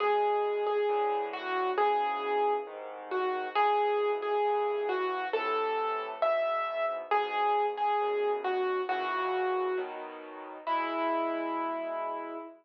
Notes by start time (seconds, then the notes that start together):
0.00 E2 B2 G#3 G#4
0.67 G#4
0.89 A2 D3 E3
1.33 F#4
1.77 G#2 B2 C#3 E3 G#4
2.67 C2 G#2 D#3
3.11 F#4
3.55 C#2 G#2 B2 E3 G#4
4.22 G#4
4.45 C2 G2 E3
4.89 F#4
5.33 A2 C3 E3 A4
6.22 E2 G#2 B2 E5
7.11 E2 G#2 B2 G#4
7.77 G#4
8.01 D#2 F#2 B2
8.44 F#4
8.89 F#2 A#2 C#3 E3 F#4
9.77 B2 D#3 F#3
10.67 E2 B2 G#3 E4